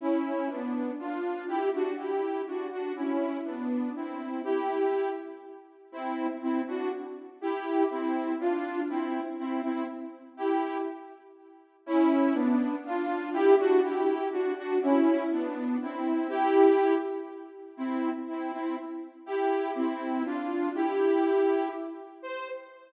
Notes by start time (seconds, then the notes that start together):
0.01 C#4 E4
0.49 B3 D4
0.99 D4 F4
1.48 E4 G4
1.74 D4 F#4
1.98 E4 G4
2.47 D4 F#4
2.71 D4 F#4
2.95 C#4 E4
3.45 B3 D4
3.95 C4 E4
4.44 E4 G4
5.92 C4 E4
6.42 C4 E4
6.67 D4 F#4
7.41 E4 G4
7.90 C4 E4
8.40 D4 F4
8.89 C4 E4
9.38 C4 E4
9.63 C4 E4
10.37 E4 G4
11.86 C#4 E4
12.34 B3 D4
12.85 D4 F4
13.33 E4 G4
13.59 D4 F#4
13.83 E4 G4
14.31 D4 F#4
14.57 D4 F#4
14.82 C#4 E4
15.31 B3 D4
15.81 C4 E4
16.29 E4 G4
17.77 C4 E4
18.28 C4 E4
18.52 C4 E4
19.26 E4 G4
19.75 C4 E4
20.25 D4 F4
20.74 E4 G4
22.22 C5